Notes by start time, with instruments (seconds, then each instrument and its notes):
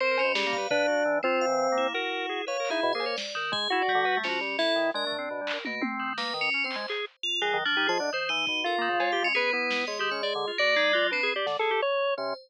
0.00 tubular bells C4, drawbar organ A#4 C5
0.11 drawbar organ A#4
0.18 tubular bells C#4, cowbell
0.24 drawbar organ B2
0.35 drawbar organ G3 G#4, snare
0.46 drawbar organ A#3
0.53 tubular bells F5, kick
0.58 drawbar organ B4
0.71 drawbar organ D4 B4, floor tom
0.88 drawbar organ F#4
1.05 drawbar organ E3
1.23 tubular bells C4, drawbar organ C4 F4, floor tom
1.41 tubular bells F5
1.47 drawbar organ E3
1.72 drawbar organ A#3
1.76 tubular bells E4, floor tom
1.94 drawbar organ F#4 A#4
2.29 drawbar organ G#4
2.47 drawbar organ B4 C#5, tubular bells F5
2.60 drawbar organ A#4
2.65 clap
2.70 drawbar organ D#4 E4, tubular bells G#4
2.83 drawbar organ B2
2.93 drawbar organ A#3 G#4, tubular bells C5
3.00 cowbell
3.06 drawbar organ C#5
3.17 tubular bells D5, snare
3.35 tubular bells D#3, drawbar organ A#4
3.52 drawbar organ G#3, tubular bells G#4, kick
3.70 drawbar organ E4 F#4
3.82 drawbar organ D5
3.88 tubular bells G3, kick
3.95 drawbar organ D3
4.05 drawbar organ B4
4.17 drawbar organ A3
4.24 drawbar organ F3, tubular bells C#4, snare
4.29 drawbar organ F#4
4.41 drawbar organ G3
4.58 drawbar organ E4, tubular bells A4, snare
4.76 drawbar organ D#3
4.94 drawbar organ G#3 D4, tubular bells A#4
5.07 drawbar organ A3
5.12 floor tom
5.18 drawbar organ C4
5.31 drawbar organ B2
5.41 drawbar organ G3
5.47 clap
5.53 drawbar organ A#4
5.65 drawbar organ B2, tubular bells A#3, high tom
5.81 drawbar organ C4, high tom
5.99 tubular bells D#3
6.18 drawbar organ A#3, tubular bells B4, snare
6.34 drawbar organ D#3
6.41 tubular bells C#4
6.54 drawbar organ C#4
6.64 drawbar organ C4, tubular bells C5
6.71 clap
6.76 drawbar organ G#3
6.88 drawbar organ G#4, clap
7.23 tubular bells F4
7.41 drawbar organ D#3 G#4, tubular bells F#3
7.53 drawbar organ D#3
7.65 tubular bells F3, drawbar organ D4
7.76 drawbar organ D#4 G4
7.87 drawbar organ F3 G#4, tubular bells D#5
7.99 drawbar organ D3 D4
8.13 tubular bells D#3, drawbar organ C5
8.29 drawbar organ E3, tubular bells D#4
8.47 drawbar organ B2, kick
8.64 drawbar organ F4 A4, tubular bells A#4
8.78 tubular bells D#3, drawbar organ A#3
8.89 drawbar organ C#3
9.00 tubular bells G#3, drawbar organ C#5, cowbell
9.12 drawbar organ G4, tubular bells F5
9.22 drawbar organ G#3, tubular bells C#4
9.35 tubular bells B3, drawbar organ G#4 B4
9.52 drawbar organ B3 E4
9.71 snare
9.87 drawbar organ G#3 C#5, tubular bells D#5
9.99 tubular bells D#3, drawbar organ G4
10.11 drawbar organ C#4, tubular bells C#5
10.23 tubular bells G#4, drawbar organ D5
10.35 drawbar organ D3
10.47 drawbar organ F4
10.58 tubular bells A#3, drawbar organ F#4 D5
10.76 tubular bells G#3, drawbar organ D#4
10.93 tubular bells F#3, drawbar organ F4
11.11 tubular bells C4, drawbar organ D4 B4
11.23 drawbar organ G#4
11.36 drawbar organ G4 D5
11.46 drawbar organ D3, snare
11.59 drawbar organ G#4 A4
11.71 drawbar organ G4
11.82 drawbar organ C#5
12.17 drawbar organ C3 C#4, tubular bells C5